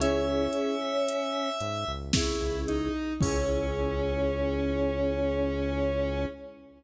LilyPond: <<
  \new Staff \with { instrumentName = "Choir Aahs" } { \time 3/4 \key cis \dorian \tempo 4 = 56 cis'4. r4. | cis'2. | }
  \new Staff \with { instrumentName = "Lead 1 (square)" } { \time 3/4 \key cis \dorian e''2 e'8 dis'8 | cis'2. | }
  \new Staff \with { instrumentName = "Vibraphone" } { \time 3/4 \key cis \dorian <cis' e' gis'>2 <cis' e' gis'>4 | <cis' e' gis'>2. | }
  \new Staff \with { instrumentName = "Synth Bass 1" } { \clef bass \time 3/4 \key cis \dorian cis,4. gis,16 cis,8 cis,8. | cis,2. | }
  \new DrumStaff \with { instrumentName = "Drums" } \drummode { \time 3/4 hh8 hh8 hh8 hh8 <bd sn>8 hh8 | <cymc bd>4 r4 r4 | }
>>